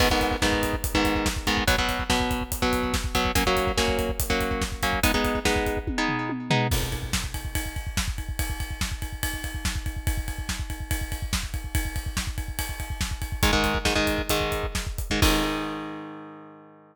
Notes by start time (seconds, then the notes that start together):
0.00 G#2 D#3 B3, kick, crash
0.10 G#2 D#3 B3, kick
0.21 kick, closed hi-hat
0.31 kick
0.42 G#2 D#3 B3, kick, snare
0.52 kick
0.63 kick, closed hi-hat
0.73 kick
0.84 kick, closed hi-hat
0.94 G#2 D#3 B3, kick
1.05 kick, closed hi-hat
1.15 kick
1.26 kick, snare
1.36 kick
1.47 G#2 D#3 B3, kick, closed hi-hat
1.57 kick
1.67 B2 F#3 B3, kick, closed hi-hat
1.78 B2 F#3 B3, kick
1.89 kick, closed hi-hat
1.99 kick
2.10 B2 F#3 B3, kick, snare
2.20 kick
2.31 kick, closed hi-hat
2.41 kick
2.52 kick, closed hi-hat
2.62 B2 F#3 B3, kick
2.73 kick, closed hi-hat
2.83 kick
2.94 kick, snare
3.04 kick
3.15 B2 F#3 B3, kick, closed hi-hat
3.25 kick
3.35 F#3 A#3 C#4, kick, closed hi-hat
3.46 F#3 A#3 C#4, kick
3.57 kick, closed hi-hat
3.67 kick
3.77 F#3 A#3 C#4, kick, snare
3.88 kick
3.99 kick, closed hi-hat
4.09 kick
4.20 kick, closed hi-hat
4.30 F#3 A#3 C#4, kick
4.41 kick, closed hi-hat
4.51 kick
4.62 kick, snare
4.72 kick
4.83 F#3 A#3 C#4, kick, closed hi-hat
4.93 kick
5.03 G#3 B3 D#4, kick, closed hi-hat
5.14 G#3 B3 D#4, kick
5.24 kick, closed hi-hat
5.35 kick
5.45 G#3 B3 D#4, kick, snare
5.56 kick
5.66 kick, closed hi-hat
5.77 kick
5.87 kick, high tom
5.98 G#3 B3 D#4
6.08 floor tom
6.29 high tom
6.50 G#3 B3 D#4, floor tom
6.71 kick, crash
6.82 kick
6.92 kick, ride
7.03 kick
7.13 kick, snare
7.24 kick
7.34 kick, ride
7.45 kick
7.55 kick, ride
7.66 kick
7.76 kick, ride
7.87 kick
7.97 kick, snare
8.08 kick
8.18 kick, ride
8.29 kick
8.39 kick, ride
8.50 kick
8.60 kick, ride
8.71 kick
8.81 kick, snare
8.92 kick
9.02 kick, ride
9.13 kick
9.23 kick, ride
9.34 kick
9.44 kick, ride
9.55 kick
9.65 kick, snare
9.76 kick
9.86 kick, ride
9.97 kick
10.07 kick, ride
10.17 kick
10.28 kick, ride
10.38 kick
10.49 kick, snare
10.59 kick
10.70 kick, ride
10.80 kick
10.91 kick, ride
11.01 kick
11.12 kick, ride
11.22 kick
11.33 kick, snare
11.43 kick
11.54 kick, ride
11.64 kick
11.75 kick, ride
11.85 kick
11.96 kick, ride
12.06 kick
12.17 kick, snare
12.27 kick
12.38 kick, ride
12.48 kick
12.59 kick, ride
12.69 kick
12.80 kick, ride
12.90 kick
13.01 kick, snare
13.11 kick
13.22 kick, ride
13.32 kick
13.43 G#2 D#3 G#3, kick, closed hi-hat
13.53 G#2 D#3 G#3, kick
13.64 kick, closed hi-hat
13.75 kick
13.85 G#2 D#3 G#3, kick, snare
13.95 G#2 D#3 G#3, kick
14.07 kick, closed hi-hat
14.18 kick
14.29 G#2 D#3 G#3, kick, closed hi-hat
14.41 kick
14.52 kick, closed hi-hat
14.63 kick
14.75 kick, snare
14.87 kick
14.98 kick, closed hi-hat
15.10 G#2 D#3 G#3, kick
15.22 G#2 D#3 G#3, kick, crash